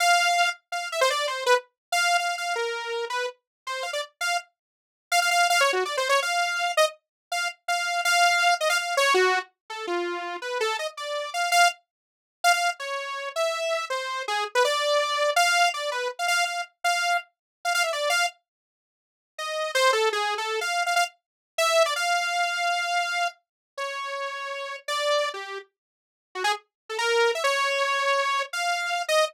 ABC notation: X:1
M:5/4
L:1/16
Q:1/4=164
K:none
V:1 name="Lead 2 (sawtooth)"
f6 z2 f2 e c d2 c2 B z3 | z f3 f2 f2 _B6 =B2 z4 | c2 f d z2 f2 z8 f f f2 | (3f2 _d2 _G2 (3=d2 c2 _d2 f6 _e z5 |
f2 z2 f4 f6 _e f f2 _d2 | _G3 z3 A2 F6 B2 A2 _e z | d4 f2 f2 z8 f f2 z | _d6 e6 c4 _A2 z B |
d8 f4 d2 B2 z f f2 | f2 z2 f4 z5 f f e d2 f2 | z12 _e4 c2 A2 | (3_A4 =A4 f4 f f z6 e3 d |
f16 z4 | _d12 =d5 G3 | z8 _G _A z4 =A _B4 e | _d12 f6 _e2 |]